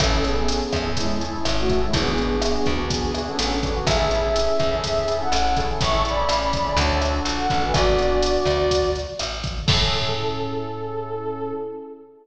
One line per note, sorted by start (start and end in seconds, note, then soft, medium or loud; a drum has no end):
0.00 0.62 A1 loud
0.00 0.09 C#4 medium
0.00 0.20 C#4 medium
0.00 0.09 E4 loud
0.00 0.09 G#4 loud
0.00 0.09 A4 loud
0.00 0.20 A4 loud
0.00 kick medium
0.00 cross-stick loud
0.00 closed hi-hat loud
0.12 0.22 C#4 medium
0.12 0.22 E4 medium
0.12 0.22 G#4 loud
0.12 0.22 A4 medium
0.24 0.89 B3 medium
0.24 0.34 C#4 medium
0.24 0.34 E4 medium
0.24 0.89 G#4 medium
0.24 0.34 G#4 medium
0.24 0.34 A4 medium
0.24 closed hi-hat medium
0.36 0.46 C#4 loud
0.36 0.46 E4 medium
0.36 0.46 G#4 loud
0.36 0.46 A4 medium
0.48 0.77 C#4 medium
0.48 0.77 E4 medium
0.48 0.77 G#4 medium
0.48 0.77 A4 medium
0.48 closed hi-hat loud
0.72 1.35 E2 medium
0.72 kick medium
0.72 cross-stick medium
0.72 closed hi-hat medium
0.85 1.14 C#4 medium
0.85 1.14 E4 medium
0.85 1.14 G#4 medium
0.85 1.14 A4 medium
0.97 1.19 G#3 medium
0.97 1.19 E4 medium
0.97 kick medium
0.97 closed hi-hat medium
1.21 1.31 C#4 medium
1.21 1.31 E4 medium
1.21 1.31 G#4 loud
1.21 1.31 A4 medium
1.21 closed hi-hat medium
1.33 1.62 C#4 medium
1.33 1.62 E4 loud
1.33 1.62 G#4 medium
1.33 1.62 A4 medium
1.45 1.86 G#1 medium
1.45 cross-stick medium
1.45 closed hi-hat medium
1.58 1.79 A3 medium
1.58 1.79 F#4 medium
1.69 1.80 C#4 medium
1.69 1.80 E4 loud
1.69 1.80 G#4 medium
1.69 1.80 A4 medium
1.69 kick medium
1.69 closed hi-hat medium
1.81 1.94 G#3 medium
1.81 1.91 C#4 loud
1.81 1.91 E4 medium
1.81 1.94 E4 medium
1.81 1.91 G#4 medium
1.81 1.91 A4 medium
1.93 2.56 G#1 loud
1.93 2.72 B3 medium
1.93 2.03 B3 loud
1.93 2.03 D4 loud
1.93 2.03 F#4 loud
1.93 2.72 G#4 medium
1.93 2.03 G#4 loud
1.93 kick medium
1.93 closed hi-hat medium
2.06 2.15 B3 loud
2.06 2.15 D4 medium
2.06 2.15 F#4 medium
2.06 2.15 G#4 medium
2.18 2.28 B3 medium
2.18 2.28 D4 medium
2.18 2.28 F#4 medium
2.18 2.28 G#4 medium
2.18 closed hi-hat medium
2.30 2.40 B3 medium
2.30 2.40 D4 medium
2.30 2.40 F#4 medium
2.30 2.40 G#4 medium
2.42 2.71 B3 medium
2.42 2.71 D4 medium
2.42 2.71 F#4 loud
2.42 2.71 G#4 medium
2.42 cross-stick loud
2.42 closed hi-hat medium
2.66 3.28 D2 medium
2.66 kick medium
2.66 closed hi-hat medium
2.78 3.07 B3 medium
2.78 3.07 D4 medium
2.78 3.07 F#4 medium
2.78 3.07 G#4 medium
2.90 3.21 B3 medium
2.90 3.21 G#4 medium
2.90 kick medium
2.90 closed hi-hat medium
3.14 3.24 B3 medium
3.14 3.24 D4 medium
3.14 3.24 F#4 medium
3.14 3.24 G#4 medium
3.14 cross-stick medium
3.14 closed hi-hat medium
3.27 3.56 B3 medium
3.27 3.57 C#4 medium
3.27 3.56 D4 medium
3.27 3.56 F#4 medium
3.27 3.56 G#4 loud
3.27 3.57 A4 medium
3.39 3.80 A1 medium
3.39 closed hi-hat loud
3.63 3.72 B3 loud
3.63 3.72 D4 loud
3.63 3.72 F#4 loud
3.63 3.72 G#4 medium
3.63 kick medium
3.63 closed hi-hat medium
3.75 3.84 B3 loud
3.75 3.84 D4 medium
3.75 3.84 F#4 loud
3.75 3.84 G#4 medium
3.87 4.48 A1 loud
3.87 3.96 C#4 loud
3.87 3.96 E4 loud
3.87 3.96 G#4 loud
3.87 4.76 G#4 medium
3.87 3.96 A4 loud
3.87 4.76 E5 medium
3.87 kick medium
3.87 cross-stick loud
3.87 closed hi-hat loud
3.99 4.09 C#4 medium
3.99 4.09 E4 medium
3.99 4.09 G#4 medium
3.99 4.09 A4 medium
4.11 4.21 C#4 medium
4.11 4.21 E4 medium
4.11 4.21 G#4 medium
4.11 4.21 A4 medium
4.11 closed hi-hat medium
4.23 4.32 C#4 medium
4.23 4.32 E4 medium
4.23 4.32 G#4 medium
4.23 4.32 A4 medium
4.36 4.65 C#4 medium
4.36 4.65 E4 medium
4.36 4.65 G#4 medium
4.36 4.65 A4 medium
4.36 closed hi-hat medium
4.59 5.22 E2 medium
4.59 kick medium
4.59 cross-stick medium
4.59 closed hi-hat medium
4.72 5.01 C#4 medium
4.72 5.01 E4 medium
4.72 5.01 G#4 loud
4.72 5.01 A4 medium
4.84 5.16 G#4 medium
4.84 5.16 E5 medium
4.84 kick medium
4.84 closed hi-hat medium
5.07 5.17 C#4 medium
5.07 5.17 E4 medium
5.07 5.17 G#4 medium
5.07 5.17 A4 medium
5.07 closed hi-hat medium
5.20 5.49 C#4 medium
5.20 5.49 E4 medium
5.20 5.49 G#4 medium
5.20 5.49 A4 medium
5.20 5.56 A4 medium
5.20 5.56 F#5 medium
5.32 5.73 A1 loud
5.32 cross-stick medium
5.32 closed hi-hat medium
5.57 5.91 C#4 loud
5.57 5.91 E4 loud
5.57 5.91 G#4 loud
5.57 5.91 A4 loud
5.57 kick medium
5.57 closed hi-hat medium
5.81 6.25 A1 loud
5.81 6.02 E5 medium
5.81 6.02 C#6 medium
5.81 kick medium
5.81 closed hi-hat medium
5.93 6.02 C#4 medium
5.93 6.02 E4 loud
5.93 6.02 G#4 medium
5.93 6.02 A4 medium
6.05 6.15 C#4 medium
6.05 6.15 E4 medium
6.05 6.15 G#4 loud
6.05 6.15 A4 medium
6.05 6.77 D5 medium
6.05 6.77 B5 medium
6.05 closed hi-hat medium
6.17 6.27 C#4 medium
6.17 6.27 E4 medium
6.17 6.27 G#4 medium
6.17 6.27 A4 medium
6.29 6.72 A1 medium
6.29 6.58 C#4 medium
6.29 6.58 E4 medium
6.29 6.58 G#4 medium
6.29 6.58 A4 medium
6.29 cross-stick medium
6.29 closed hi-hat medium
6.53 kick medium
6.53 closed hi-hat medium
6.65 6.74 C#4 medium
6.65 6.74 E4 medium
6.65 6.74 G#4 medium
6.65 6.74 A4 medium
6.77 7.20 D2 loud
6.77 6.96 D4 loud
6.77 6.96 F#4 loud
6.77 6.96 A4 loud
6.77 6.98 C#5 medium
6.77 6.98 A5 medium
6.77 kick medium
6.77 closed hi-hat medium
7.01 7.11 D4 loud
7.01 7.11 F#4 loud
7.01 7.11 A4 medium
7.01 cross-stick medium
7.01 closed hi-hat medium
7.13 7.42 D4 medium
7.13 7.42 F#4 medium
7.13 7.42 A4 medium
7.25 7.47 A#1 medium
7.25 closed hi-hat medium
7.37 7.59 A4 medium
7.37 7.59 F#5 medium
7.50 7.72 A1 medium
7.50 7.59 D4 loud
7.50 7.59 F#4 medium
7.50 7.59 A4 medium
7.50 kick medium
7.50 closed hi-hat medium
7.62 7.72 D4 medium
7.62 7.72 F#4 medium
7.62 7.72 A4 medium
7.62 7.74 B4 medium
7.62 7.74 G#5 medium
7.73 8.37 G#1 loud
7.73 7.93 B3 loud
7.73 7.93 D4 loud
7.73 7.93 F#4 loud
7.73 8.90 F#4 medium
7.73 7.93 G#4 loud
7.73 8.90 D5 loud
7.73 kick medium
7.73 cross-stick medium
7.73 closed hi-hat medium
7.98 8.37 B3 medium
7.98 8.37 D4 medium
7.98 8.37 F#4 medium
7.98 8.37 G#4 medium
7.98 closed hi-hat medium
8.22 closed hi-hat loud
8.45 9.07 D2 medium
8.45 kick medium
8.45 cross-stick medium
8.45 closed hi-hat medium
8.71 kick medium
8.71 closed hi-hat loud
8.95 closed hi-hat medium
9.19 9.62 A1 medium
9.19 cross-stick medium
9.19 closed hi-hat medium
9.44 kick medium
9.44 closed hi-hat medium
9.66 11.53 A2 loud
9.66 11.52 C#4 loud
9.66 11.52 E4 medium
9.66 11.52 G#4 loud
9.66 11.50 A4 loud
9.66 11.52 A4 loud
9.66 kick loud
9.66 crash loud